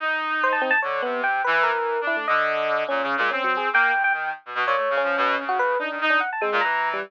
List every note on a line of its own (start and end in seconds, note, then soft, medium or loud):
0.00 0.74 D#4 medium
0.44 0.53 C5 loud
0.52 0.62 A5 medium
0.62 0.71 C4 loud
0.71 0.80 A5 loud
0.82 1.01 D3 medium
0.82 1.01 C#5 medium
1.02 1.40 C3 medium
1.02 1.21 B3 loud
1.24 1.42 G5 medium
1.44 1.71 E3 loud
1.44 1.63 B4 medium
1.63 2.01 A#4 loud
1.72 1.97 E3 medium
2.01 2.26 D4 medium
2.07 2.16 E4 medium
2.17 2.26 A3 medium
2.28 2.83 D3 loud
2.28 2.84 D#5 medium
2.89 3.01 A#2 medium
2.89 3.16 C#4 medium
3.02 3.15 C#3 medium
3.17 3.29 A#2 loud
3.17 3.30 G#3 medium
3.31 3.69 C4 medium
3.31 3.43 C#4 medium
3.44 3.56 F#3 medium
3.57 3.69 G#4 medium
3.73 3.92 A#3 loud
3.73 4.02 G5 loud
3.93 4.11 A2 medium
4.04 4.13 G5 loud
4.13 4.31 D#3 medium
4.13 4.32 G5 medium
4.45 4.54 B2 medium
4.55 4.64 B2 loud
4.66 4.75 A#2 loud
4.66 4.96 C#5 medium
4.76 4.88 A3 medium
4.90 5.02 C#3 medium
4.97 5.44 C#4 loud
5.03 5.16 F3 medium
5.17 5.35 B2 loud
5.38 5.76 C#3 medium
5.49 5.58 F#4 loud
5.59 5.78 B4 loud
5.79 5.98 D4 medium
5.79 5.89 D#4 medium
5.91 6.00 D#3 medium
6.01 6.20 D#4 loud
6.10 6.19 D4 medium
6.20 6.30 F#5 medium
6.33 6.42 A5 medium
6.41 6.60 G#3 loud
6.41 6.50 C4 medium
6.52 6.61 A#2 loud
6.61 6.99 E3 medium
6.61 6.89 A#5 medium
6.94 7.03 G3 medium